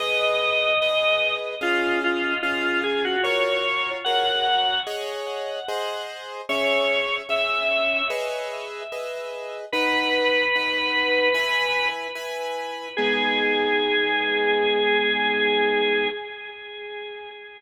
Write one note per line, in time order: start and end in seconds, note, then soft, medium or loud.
0.00 0.73 G#4 loud
0.00 0.73 B4 loud
0.00 0.73 D#5 loud
0.00 1.34 D#5 loud
0.82 1.55 G#4 medium
0.82 1.55 B4 loud
0.82 1.55 D#5 medium
1.61 2.34 C#4 loud
1.61 1.99 F4 loud
1.61 2.34 G#4 loud
1.61 2.34 F5 loud
2.04 2.39 F4 medium
2.43 3.16 C#4 medium
2.43 2.81 F4 medium
2.43 3.16 G#4 medium
2.43 3.16 F5 loud
2.84 3.03 G#4 medium
3.05 3.24 F#4 medium
3.23 3.97 F#4 loud
3.23 3.97 A#4 loud
3.23 3.90 C#5 loud
3.23 3.97 C#5 loud
4.04 4.79 F#4 medium
4.04 4.79 A#4 loud
4.04 4.79 C#5 medium
4.04 4.80 F#5 loud
4.87 5.60 G#4 loud
4.87 5.60 C#5 loud
4.87 5.60 D#5 loud
5.68 6.41 G#4 loud
5.68 6.41 C5 loud
5.68 6.41 D#5 loud
6.49 7.22 C#4 loud
6.49 7.22 G#4 loud
6.49 7.15 C#5 loud
6.49 7.22 E5 loud
7.29 8.02 C#4 loud
7.29 8.02 G#4 medium
7.29 8.02 E5 medium
7.29 8.07 E5 loud
8.10 8.83 G#4 loud
8.10 8.83 B4 loud
8.10 8.83 D#5 loud
8.92 9.65 G#4 medium
8.92 9.65 B4 loud
8.92 9.65 D#5 loud
9.72 10.46 D#4 loud
9.72 11.88 B4 loud
9.72 10.46 B4 loud
9.72 10.46 F#5 loud
10.56 11.29 D#4 medium
10.56 11.29 B4 medium
10.56 11.29 F#5 medium
11.34 12.07 E4 loud
11.34 12.07 B4 loud
11.34 12.07 G#5 loud
12.15 12.88 E4 loud
12.15 12.88 B4 medium
12.15 12.88 G#5 loud
12.97 16.09 G#3 loud
12.97 16.09 B3 loud
12.97 16.09 D#4 loud
12.97 16.08 G#4 loud